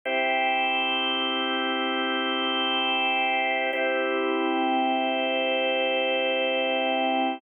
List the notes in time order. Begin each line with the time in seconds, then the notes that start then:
0.05 C4 E4 G4
3.73 C4 E4 G4